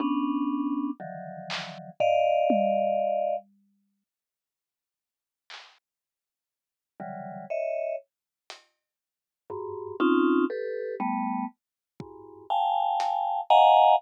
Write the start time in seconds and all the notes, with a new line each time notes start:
0.00 B3 C#4 D4
1.00 D3 D#3 E3 F3 F#3
1.50 clap
2.00 D5 D#5 F5, floor tom
2.50 high tom
5.50 clap
7.00 C#3 D3 E3 F#3 G3
7.50 C#5 D#5 E5
8.50 closed hi-hat
9.50 F#2 G2 G#2
10.00 C4 C#4 D#4 F4
10.50 G4 A4 B4
11.00 G3 A3 B3
12.00 E2 F#2 G2 G#2, kick
12.50 F5 G5 G#5 A5
13.00 closed hi-hat
13.50 D#5 F5 F#5 G#5 A#5